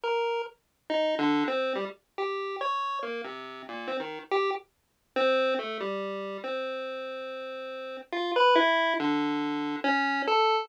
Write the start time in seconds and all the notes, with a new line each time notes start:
0.04 A#4
0.90 D#4
1.19 D3
1.48 C4
1.75 G3
2.18 G4
2.61 C#5
3.03 A#3
3.24 C3
3.68 A#2
3.88 C4
4.00 D#3
4.31 G4
5.16 C4
5.59 A3
5.80 G3
6.44 C4
8.12 F4
8.36 B4
8.55 E4
9.00 D3
9.84 C#4
10.27 A4